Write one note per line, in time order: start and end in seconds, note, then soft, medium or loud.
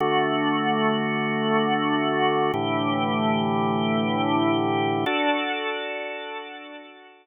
0.00 2.51 D3 medium
0.00 2.51 A3 medium
0.00 2.51 F#4 medium
2.54 5.05 A2 medium
2.54 5.05 D3 medium
2.54 5.05 E3 medium
2.54 5.05 G4 medium
5.06 7.26 D4 medium
5.06 7.26 F#4 medium
5.06 7.26 A4 medium